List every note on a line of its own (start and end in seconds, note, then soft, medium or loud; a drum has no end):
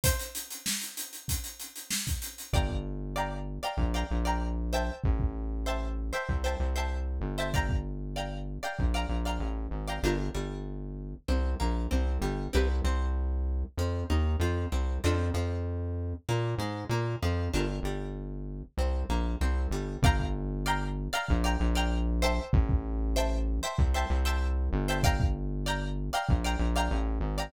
0.04 0.16 C5 medium
0.04 0.16 E5 medium
0.04 0.16 G5 loud
0.04 0.16 A5 medium
0.04 kick medium
0.04 closed hi-hat medium
0.19 closed hi-hat medium
0.35 closed hi-hat medium
0.51 closed hi-hat medium
0.66 snare medium
0.81 closed hi-hat medium
0.97 closed hi-hat medium
1.13 closed hi-hat soft
1.28 kick medium
1.28 closed hi-hat medium
1.44 closed hi-hat medium
1.60 closed hi-hat medium
1.76 closed hi-hat medium
1.90 snare medium
2.07 kick medium
2.07 snare soft
2.07 closed hi-hat medium
2.22 closed hi-hat medium
2.38 closed hi-hat soft
2.53 3.59 G1 medium
2.53 3.04 D5 loud
2.53 3.04 F5 medium
2.53 3.04 G5 medium
2.53 3.04 A#5 loud
2.53 kick medium
2.69 kick medium
3.16 3.53 D5 medium
3.16 3.53 F5 medium
3.16 3.53 G5 medium
3.16 3.53 A#5 medium
3.63 3.88 D5 medium
3.63 3.88 F5 medium
3.63 3.88 G5 medium
3.63 3.88 A#5 medium
3.77 4.04 A#1 medium
3.77 kick medium
3.94 4.19 D5 medium
3.94 4.19 F5 medium
3.94 4.19 G5 medium
3.94 4.19 A#5 medium
4.11 4.90 A#1 medium
4.25 4.70 D5 medium
4.25 4.70 F5 medium
4.25 4.70 G5 medium
4.25 4.70 A#5 medium
4.73 5.54 C5 loud
4.73 5.54 E5 medium
4.73 5.54 G5 loud
4.73 5.54 A5 loud
5.04 6.11 A1 medium
5.04 kick medium
5.20 kick medium
5.66 6.04 C5 medium
5.66 6.04 E5 medium
5.66 6.04 G5 medium
5.66 6.04 A5 medium
6.13 6.38 C5 medium
6.13 6.38 E5 medium
6.13 6.38 G5 medium
6.13 6.38 A5 medium
6.29 6.55 C2 medium
6.29 kick medium
6.44 6.69 C5 medium
6.44 6.69 E5 medium
6.44 6.69 G5 medium
6.44 6.69 A5 medium
6.60 7.19 C2 medium
6.76 7.26 C5 medium
6.76 7.26 E5 medium
6.76 7.26 G5 medium
6.76 7.26 A5 medium
7.21 8.58 G1 medium
7.38 7.50 C5 medium
7.38 7.50 E5 medium
7.38 7.50 G5 medium
7.38 7.50 A5 medium
7.54 8.04 D5 loud
7.54 8.04 F5 loud
7.54 8.04 G5 loud
7.54 8.04 A#5 loud
7.54 kick medium
7.69 kick medium
8.16 8.54 D5 medium
8.16 8.54 F5 medium
8.16 8.54 G5 medium
8.16 8.54 A#5 medium
8.63 8.88 D5 medium
8.63 8.88 F5 medium
8.63 8.88 G5 medium
8.63 8.88 A#5 medium
8.79 9.06 A#1 medium
8.79 kick medium
8.94 9.19 D5 medium
8.94 9.19 F5 medium
8.94 9.19 G5 medium
8.94 9.19 A#5 medium
9.09 9.39 A#1 medium
9.25 9.75 D5 medium
9.25 9.75 F5 medium
9.25 9.75 G5 medium
9.25 9.75 A#5 medium
9.39 9.68 A1 medium
9.71 9.99 G#1 medium
9.88 10.00 D5 medium
9.88 10.00 F5 medium
9.88 10.00 G5 medium
9.88 10.00 A#5 medium
10.03 10.30 G1 loud
10.03 10.16 D4 medium
10.03 10.16 F4 medium
10.03 10.16 G4 medium
10.03 10.16 A#4 medium
10.35 11.15 G1 medium
10.35 11.14 G3 medium
11.28 11.55 C2 medium
11.28 11.55 C4 medium
11.60 11.87 A#1 medium
11.60 11.86 A#3 medium
11.91 12.18 C2 medium
11.91 12.17 C4 medium
12.21 12.48 G1 medium
12.21 12.48 G3 medium
12.53 12.81 C2 loud
12.53 12.66 C4 medium
12.53 12.66 E4 medium
12.53 12.66 G4 medium
12.53 12.66 B4 medium
12.84 13.64 C2 medium
12.84 13.64 C4 medium
13.77 14.04 F2 medium
13.77 14.05 F3 medium
14.10 14.36 D#2 medium
14.10 14.36 D#4 medium
14.40 14.66 F2 medium
14.40 14.68 F3 medium
14.72 14.99 C2 medium
14.72 14.99 C4 medium
15.04 15.31 F2 loud
15.04 15.16 C4 medium
15.04 15.16 D4 medium
15.04 15.16 F4 medium
15.04 15.16 A4 medium
15.34 16.14 F2 medium
15.34 16.14 F3 medium
16.29 16.55 A#2 medium
16.29 16.55 A#3 medium
16.58 16.85 G#2 medium
16.58 16.86 G#3 medium
16.89 17.16 A#2 medium
16.89 17.17 A#3 medium
17.23 17.49 F2 medium
17.23 17.49 F3 medium
17.54 17.80 G1 medium
17.54 17.66 D4 medium
17.54 17.66 F4 medium
17.54 17.66 G4 medium
17.54 17.66 A#4 medium
17.83 18.63 G1 medium
17.83 18.65 G3 medium
18.77 19.04 C2 medium
18.77 19.05 C4 medium
19.09 19.36 A#1 medium
19.09 19.36 A#3 medium
19.41 19.67 C2 medium
19.41 19.68 C4 medium
19.71 19.97 G1 medium
19.71 19.99 G3 medium
20.02 21.09 G1 loud
20.02 20.54 D5 loud
20.02 20.54 F5 loud
20.02 20.54 G5 loud
20.02 20.54 A#5 loud
20.02 kick loud
20.19 kick medium
20.66 21.03 D5 loud
20.66 21.03 F5 loud
20.66 21.03 G5 loud
20.66 21.03 A#5 loud
21.13 21.38 D5 loud
21.13 21.38 F5 loud
21.13 21.38 G5 loud
21.13 21.38 A#5 loud
21.29 21.57 A#1 loud
21.29 kick medium
21.44 21.69 D5 loud
21.44 21.69 F5 medium
21.44 21.69 G5 loud
21.44 21.69 A#5 loud
21.60 22.40 A#1 loud
21.75 22.20 D5 loud
21.75 22.20 F5 loud
21.75 22.20 G5 loud
21.75 22.20 A#5 loud
22.22 23.03 C5 loud
22.22 23.03 E5 loud
22.22 23.03 G5 loud
22.22 23.03 A5 loud
22.53 23.60 A1 loud
22.53 kick loud
22.69 kick medium
23.16 23.54 C5 loud
23.16 23.54 E5 loud
23.16 23.54 G5 loud
23.16 23.54 A5 loud
23.63 23.88 C5 loud
23.63 23.88 E5 loud
23.63 23.88 G5 medium
23.63 23.88 A5 loud
23.79 24.05 C2 medium
23.79 kick medium
23.94 24.19 C5 loud
23.94 24.19 E5 loud
23.94 24.19 G5 medium
23.94 24.19 A5 loud
24.10 24.69 C2 loud
24.25 24.75 C5 loud
24.25 24.75 E5 loud
24.25 24.75 G5 loud
24.25 24.75 A5 loud
24.73 26.10 G1 loud
24.88 25.01 C5 loud
24.88 25.01 E5 loud
24.88 25.01 G5 loud
24.88 25.01 A5 loud
25.03 25.54 D5 loud
25.03 25.54 F5 loud
25.03 25.54 G5 loud
25.03 25.54 A#5 loud
25.03 kick medium
25.20 kick medium
25.66 26.04 D5 loud
25.66 26.04 F5 loud
25.66 26.04 G5 loud
25.66 26.04 A#5 loud
26.13 26.38 D5 loud
26.13 26.38 F5 loud
26.13 26.38 G5 loud
26.13 26.38 A#5 loud
26.29 26.56 A#1 medium
26.29 kick medium
26.44 26.69 D5 loud
26.44 26.69 F5 loud
26.44 26.69 G5 loud
26.44 26.69 A#5 loud
26.59 26.89 A#1 medium
26.76 27.26 D5 medium
26.76 27.26 F5 loud
26.76 27.26 G5 loud
26.76 27.26 A#5 loud
26.91 27.19 A1 loud
27.20 27.48 G#1 medium
27.38 27.50 D5 medium
27.38 27.50 F5 loud
27.38 27.50 G5 medium
27.38 27.50 A#5 loud